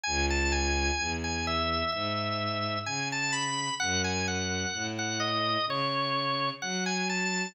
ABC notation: X:1
M:4/4
L:1/16
Q:1/4=64
K:E
V:1 name="Drawbar Organ"
g a g3 g e2 e4 g a b2 | f g f3 f d2 c4 f g a2 |]
V:2 name="Violin" clef=bass
C,,4 E,,4 G,,4 C,4 | F,,4 A,,4 C,4 F,4 |]